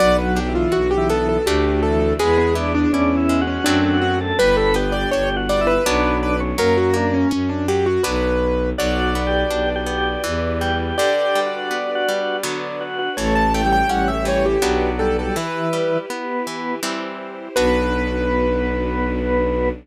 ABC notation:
X:1
M:3/4
L:1/16
Q:1/4=82
K:Bm
V:1 name="Acoustic Grand Piano"
d B G ^E F G A A G2 A2 | ^G2 E D C3 C D2 F z | B A B d c z d B3 B z | ^A F D C C D G F B4 |
d12 | d12 | c a g g f e c G3 A A | B4 z8 |
B12 |]
V:2 name="Drawbar Organ"
(3F,4 E,4 E,4 z2 E, E, | B, B, D D (3D2 E2 F2 F3 A | B B G G (3G2 F2 E2 D3 C | ^A,4 z8 |
(3F4 G4 G4 z2 G G | (3G4 F4 F4 z2 F F | (3A,4 G,4 G,4 z2 G, G, | E,4 B,4 z4 |
B,12 |]
V:3 name="Orchestral Harp"
B,2 D2 F2 B,2 [A,DF]4 | ^G,2 B,2 E2 G,2 [F,A,=CD]4 | G,2 B,2 D2 G,2 [F,B,D]4 | F,2 ^A,2 C2 F,2 [F,B,D]4 |
F,2 B,2 D2 B,2 E,2 G,2 | D,2 G,2 B,2 G,2 [D,F,B,]4 | E,2 A,2 C2 E,2 [F,B,D]4 | E,2 G,2 B,2 E,2 [E,G,=C]4 |
[B,DF]12 |]
V:4 name="Violin" clef=bass
B,,,4 B,,,4 D,,4 | E,,4 E,,4 F,,4 | G,,,4 G,,,4 B,,,4 | F,,4 F,,4 B,,,4 |
B,,,4 B,,,4 E,,4 | z12 | A,,,4 A,,,4 B,,,4 | z12 |
B,,,12 |]
V:5 name="String Ensemble 1"
[B,DF]8 [A,DF]4 | [^G,B,E]8 [F,A,=CD]4 | [G,B,D]8 [F,B,D]4 | z12 |
[FBd]8 [EGB]4 | [DGB]8 [DFB]4 | [EAc]8 [FBd]4 | [EGB]8 [EG=c]4 |
[B,DF]12 |]